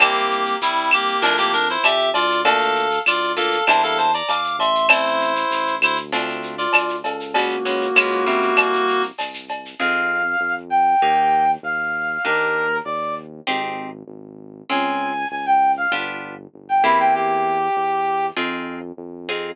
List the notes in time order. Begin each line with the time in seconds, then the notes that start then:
0.00 C2 A#3 C4 E4 G4, cowbell, claves, shaker
0.15 shaker
0.30 shaker
0.45 shaker
0.61 C2 G3 E4, tambourine, shaker
0.77 shaker
0.91 A#3 G4, claves, shaker
1.07 shaker
1.22 F2 A3 C4 D4 E4 F4 A#4, cowbell, shaker
1.38 A#3 G4, shaker
1.53 D4 A#4, shaker
1.68 E4 C5, shaker
1.83 F2 G4 E5, tambourine, cowbell, claves, shaker
1.99 shaker
2.13 D2 F4 D5, cowbell, shaker
2.30 shaker
2.44 A3 A#3 D4 F4 A4 F5, cowbell, shaker
2.61 shaker
2.75 shaker
2.91 shaker
3.06 D2 F4 D5, tambourine, claves, shaker
3.22 shaker
3.36 A3 A#3 D4 F4 A4 F5, shaker
3.51 shaker
3.67 E2 G3 A#3 D4 E4 C5 A5, cowbell, claves, shaker
3.82 A4 F5, shaker
3.98 C5 A5, shaker
4.13 D5 A#5, shaker
4.28 E2 F5 D6, tambourine, cowbell, shaker
4.43 shaker
4.59 A1 E5 C6, cowbell, shaker
4.75 shaker
4.89 A3 C4 E4 C5, cowbell, claves, shaker
5.05 shaker
5.21 shaker
5.35 shaker
5.50 A1, tambourine, shaker
5.66 shaker
5.81 D2 E4 C5, claves, shaker
5.96 shaker
6.12 A3 C4 D4 F4, cowbell, shaker
6.28 shaker
6.42 shaker
6.58 F4 D5, shaker
6.73 D2, tambourine, cowbell, claves, shaker
6.89 shaker
7.04 C#2 A4 F5, cowbell, shaker
7.20 shaker
7.34 G#3 A#3 B3 C#4 F#4, cowbell, shaker
7.50 shaker
7.65 G#3 B3 C#4 F#4, shaker
7.81 shaker
7.95 C#2 G#3 B3 C#4 F4, tambourine, claves, shaker
8.11 shaker
8.26 G3 A#3 C4 E4, shaker
8.42 shaker
8.56 C2, cowbell, claves, shaker
8.73 shaker
8.88 shaker
9.02 shaker
9.18 C2, tambourine, cowbell, shaker
9.33 shaker
9.48 cowbell, shaker
9.65 shaker
9.79 F2 C4 D#4 F4 G#4 F5
10.40 F2
10.70 G5
11.02 D#2 A#3 D#4 G4
11.63 D#2 F5
12.25 D#2 A#3 D4 D#4 G4 A#4
12.85 D#2 D5
13.47 G#1 C4 D#4 G4 G#4
14.08 G#1
14.70 C#2 C4 C#4 F4 G#4 G#5
15.31 C#2 G#5
15.46 G5
15.77 F5
15.92 G1 B3 D4 F4 G4
16.54 G1
16.69 G5
16.83 E2 A#3 C4 E4 G4 B5
16.99 G5
17.14 G4
17.76 E2
18.36 F2 C4 D#4 F4 G#4
18.97 F2
19.29 C4 D#4 F4 G#4